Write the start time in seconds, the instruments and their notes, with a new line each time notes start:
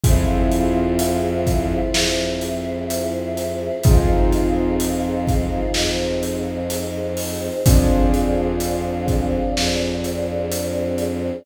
0.04 violin F2, choir aahs C4 E4 F4 G#4, acoustic grand piano C4 E4 F4 G#4, kick, closed hi-hat
0.52 closed hi-hat
0.99 closed hi-hat
1.46 kick, closed hi-hat
1.94 violin F2, choir aahs C4 E4 G#4 C5, snare
2.41 closed hi-hat
2.90 closed hi-hat
3.37 closed hi-hat
3.84 violin F2, choir aahs C4 D#4 F4 G#4, acoustic grand piano C4 D#4 F4 G#4, kick, closed hi-hat
4.33 closed hi-hat
4.80 closed hi-hat
5.28 kick, closed hi-hat
5.74 violin F2, choir aahs C4 D#4 G#4 C5, snare
6.23 closed hi-hat
6.70 closed hi-hat
7.17 open hi-hat
7.65 violin F2, choir aahs C4 D4 F4 G#4, acoustic grand piano C4 D4 F4 G#4, kick, closed hi-hat
8.14 closed hi-hat
8.60 closed hi-hat
9.08 kick, closed hi-hat
9.56 violin F2, choir aahs C4 D4 G#4 C5, snare
10.04 closed hi-hat
10.52 closed hi-hat
10.98 closed hi-hat